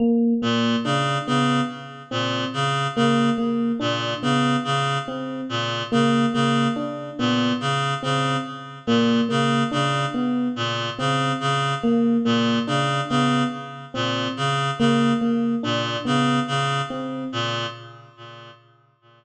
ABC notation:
X:1
M:3/4
L:1/8
Q:1/4=71
K:none
V:1 name="Clarinet" clef=bass
z ^A,, ^C, C, z A,, | ^C, C, z ^A,, C, C, | z ^A,, ^C, C, z A,, | ^C, C, z ^A,, C, C, |
z ^A,, ^C, C, z A,, | ^C, C, z ^A,, C, C, | z ^A,, ^C, C, z A,, |]
V:2 name="Electric Piano 1"
^A, A, D B, z C | z ^A, A, D B, z | C z ^A, A, D B, | z C z ^A, A, D |
B, z C z ^A, A, | D B, z C z ^A, | ^A, D B, z C z |]